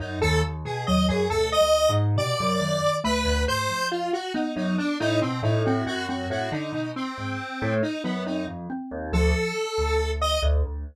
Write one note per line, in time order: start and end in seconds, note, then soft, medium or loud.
0.00 0.18 F#2 medium
0.00 0.19 D#4 medium
0.22 0.42 D#2 loud
0.22 0.41 A4 loud
0.44 0.63 D#2 medium
0.65 0.85 B2 medium
0.65 0.85 G#4 medium
0.87 1.08 D#2 medium
0.87 1.27 F#3 loud
0.87 1.06 D#5 medium
1.09 1.29 F#2 medium
1.09 1.28 G#4 medium
1.30 1.56 D2 medium
1.30 1.52 B2 medium
1.30 1.50 A4 loud
1.52 1.91 D#5 loud
1.61 1.87 D2 medium
1.89 2.15 G#2 medium
2.16 2.36 B2 medium
2.16 2.57 C3 loud
2.16 2.96 D5 loud
2.40 2.60 F#2 medium
2.61 2.80 F#2 medium
2.61 3.00 D#3 medium
3.04 3.24 D2 medium
3.04 3.82 A3 medium
3.04 3.43 B4 loud
3.25 3.45 D2 medium
3.48 3.68 G#2 medium
3.48 3.87 C5 loud
3.69 4.09 F2 soft
3.91 4.11 F4 medium
4.13 4.33 F#4 medium
4.34 5.52 B3 loud
4.34 4.54 D#4 medium
4.56 4.76 F#2 medium
4.56 4.76 D#4 medium
4.78 4.98 D4 medium
5.00 5.20 A2 loud
5.00 5.20 D#4 loud
5.21 5.42 B2 medium
5.21 5.41 C4 medium
5.43 5.82 A2 loud
5.43 5.63 D#4 medium
5.65 6.06 C4 loud
5.65 5.85 F#4 soft
5.86 6.25 F#2 loud
5.86 6.06 F#4 medium
6.08 6.48 C4 medium
6.08 6.28 F#4 medium
6.30 6.50 A2 loud
6.30 6.50 F#4 medium
6.52 6.71 D3 medium
6.52 6.91 D#4 medium
6.72 6.92 B2 medium
6.96 7.74 C4 medium
7.18 7.37 G#2 medium
7.62 7.82 A2 loud
7.83 8.02 D#4 medium
8.04 8.43 F#2 medium
8.04 8.24 B3 medium
8.26 8.66 C4 medium
8.26 8.46 D#4 medium
8.47 8.67 F2 medium
8.70 9.09 C4 medium
8.91 9.11 D#2 medium
9.12 9.32 D2 loud
9.12 9.53 F3 medium
9.12 10.11 A4 medium
9.78 10.37 D2 medium
10.21 10.41 D#5 loud
10.42 10.62 D2 loud
10.64 10.84 D2 medium